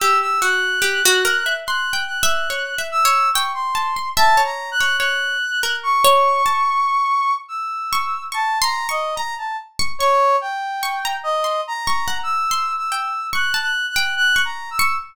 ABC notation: X:1
M:6/4
L:1/16
Q:1/4=72
K:none
V:1 name="Brass Section"
e' e' _g'6 g'2 g'4 e'2 _d' c'3 (3a2 _b2 g'2 | _g'4 _d'8 e'4 (3a2 _b2 _e2 b a z2 | _d2 g4 _e2 (3_b4 =e'4 e'4 (3_g'2 g'2 g'2 (3g'2 b2 e'2 |]
V:2 name="Pizzicato Strings"
G2 _G2 =G _G _B e (3c'2 =g2 e2 (3_d2 e2 d2 g2 a c' e d2 d | _d2 z _B2 d2 a3 z4 _d'2 (3d'2 c'2 d'2 _b z2 d' | _d' z3 d' _b2 c'2 d' _g2 c'2 =g z d' a z g2 d'2 d' |]